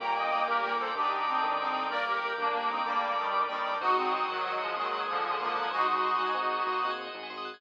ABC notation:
X:1
M:12/8
L:1/16
Q:3/8=126
K:Gm
V:1 name="Accordion"
[gb]2 [eg]4 [GB]4 [Ac]2 [EG]4 [CE]4 [CE]4 | [Bd]2 [GB]4 [B,D]4 [CE]2 [G,B,]4 [E,G,]4 [E,G,]4 | [E_G]2 [CE]4 [E,_G,]4 [F,_A,]2 [E,G,]4 [D,F,]4 [D,F,]4 | [E_G]2 [EG]14 z8 |]
V:2 name="Brass Section"
[B,,B,]4 [B,,B,]4 [B,,B,]4 [D,D]8 [D,D]4 | [B,B]4 [B,B]4 [B,B]4 [Dd]8 [Dd]4 | [_G,_G]4 [G,G]4 [G,G]4 [_A,_A]8 [B,B]4 | [_A,_A]8 z16 |]
V:3 name="Electric Piano 1"
[B,DG]24- | [B,DG]8 [B,DG]12 [B,DG]4 | [CE_G_A]24- | [CE_G_A]8 [CEGA]6 [CEGA]4 [CEGA]2 [CEGA]4 |]
V:4 name="Tubular Bells"
B d g b d' g' B d g b d' g' B d g b d' g' B d g b d' g' | B d g b d' g' B d g b d' g' B d g b d' g' B d g b d' g' | c e _g _a c' e' _g' _a' c e g a c' e' g' a' c e g a c' e' g' a' | c e _g _a c' e' _g' _a' c e g a c' e' g' a' c e g a c' e' g' a' |]
V:5 name="Synth Bass 1" clef=bass
G,,,6 G,,,6 D,,6 G,,,6 | G,,,6 G,,,6 D,,6 G,,,6 | _A,,,6 A,,,6 E,,6 A,,,6 | _A,,,6 A,,,6 E,,6 A,,,6 |]
V:6 name="Drawbar Organ"
[Bdg]24- | [Bdg]24 | [ce_g_a]24- | [ce_g_a]24 |]